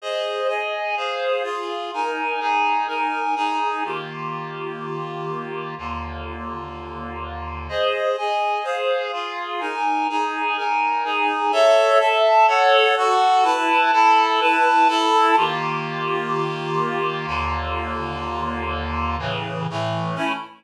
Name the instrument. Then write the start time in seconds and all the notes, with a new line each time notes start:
clarinet
0.02 G#4 C5 D#5
0.48 G#4 D#5 G#5
0.96 G#4 C5 F5
1.43 F4 G#4 F5
1.93 D#4 A#4 G#5
2.40 D#4 G#4 G#5
2.87 D#4 A#4 G#5
3.36 D#4 G#4 G#5
3.85 D#3 A#3 F4 G4
5.78 D#2 D3 A#3 F4
7.69 G#4 C5 D#5
8.18 G#4 D#5 G#5
8.64 G#4 C5 F5
9.13 F4 G#4 F5
9.60 D#4 A#4 G#5
10.09 D#4 G#4 G#5
10.57 D#4 A#4 G#5
11.04 D#4 G#4 G#5
11.52 A4 C#5 E5
11.99 A4 E5 A5
12.47 A4 C#5 F#5
12.97 F#4 A4 F#5
13.43 E4 B4 A5
13.92 E4 A4 A5
14.40 E4 B4 A5
14.88 E4 A4 A5
15.36 D#3 A#3 F4 G4
17.27 D#2 D3 A#3 F4
19.19 A2 C#3 E3
19.70 A2 E3 A3
20.15 A3 C#4 E4